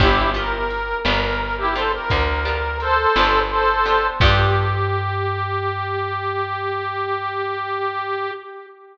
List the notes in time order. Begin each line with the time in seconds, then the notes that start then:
0.00 G1 B3 D4 E4 F4 G4, kick, crash
0.34 B3 D4 F4 G4 A#4
0.70 ride
1.05 G1 B3 D4 F4 G4 A#4, snare
1.23 A#4
1.40 A#4
1.58 E4 G4
1.75 B3 D4 F4 G4 A4 C5, ride
1.93 A#4
2.10 D2, kick, ride
2.45 B3 D4 F4 G4
2.80 A4 C5, ride
3.16 G1 B3 D4 F4 G4, snare
3.51 A4 C5
3.86 B3 D4 F4 G4, ride
4.20 G2 B3 D4 F4 G4, kick, crash